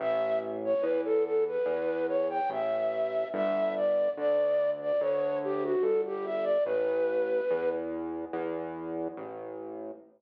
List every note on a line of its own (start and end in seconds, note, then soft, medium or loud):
0.00 0.75 A1 medium
0.00 0.39 E5 loud
0.65 0.84 C#5 medium
0.81 1.58 E2 medium
0.81 1.01 B4 medium
1.05 1.24 A4 loud
1.24 1.44 A4 medium
1.47 2.06 B4 medium
1.66 2.41 E2 medium
2.08 2.28 C#5 medium
2.30 2.50 G5 medium
2.50 3.25 A1 medium
2.50 3.28 E5 medium
3.34 4.09 G1 medium
3.34 3.75 E5 loud
3.77 4.10 D5 medium
4.17 4.92 D2 medium
4.17 4.70 D5 loud
4.81 5.01 D5 medium
5.00 5.76 D2 medium
5.00 5.39 C#5 medium
5.44 5.64 G4 loud
5.64 5.84 F#4 medium
5.81 6.58 G1 medium
5.81 6.01 A4 medium
6.06 6.26 G4 loud
6.25 6.45 E5 medium
6.44 6.64 D5 medium
6.64 7.41 A1 medium
6.64 7.69 B4 loud
7.51 8.26 E2 medium
8.33 9.08 E2 medium
9.17 9.92 A1 medium